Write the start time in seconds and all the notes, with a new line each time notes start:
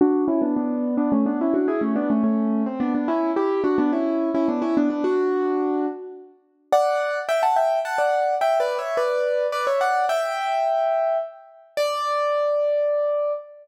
0.01 D4 F#4
0.28 C#4 E4
0.42 B3 D4
0.56 B3 D4
0.97 B3 D4
1.12 A3 C#4
1.26 B3 D4
1.41 C#4 E4
1.54 D4 F#4
1.68 E4 G#4
1.81 A3 C#4
1.96 B3 D4
2.10 A3 C#4
2.24 A3 C#4
2.66 C4
2.80 B3 D4
2.95 B3 D4
3.08 C#4 E4
3.36 E4 G4
3.64 D4 F#4
3.78 B3 D4
3.93 C#4 E4
4.34 C#4 E4
4.48 B3 D4
4.62 C#4 E4
4.77 B3 D4
4.90 B3 D4
5.04 D4 F#4
6.72 D5 F#5
7.29 E5 G5
7.43 F#5 A5
7.56 E5 G5
7.85 F#5 A5
7.98 D5 F#5
8.41 E5 G5
8.60 B4 D5
8.79 C#5 E5
8.97 B4 D5
9.52 B4 D5
9.67 C#5 E5
9.81 D5 F#5
10.09 E5 G5
11.77 D5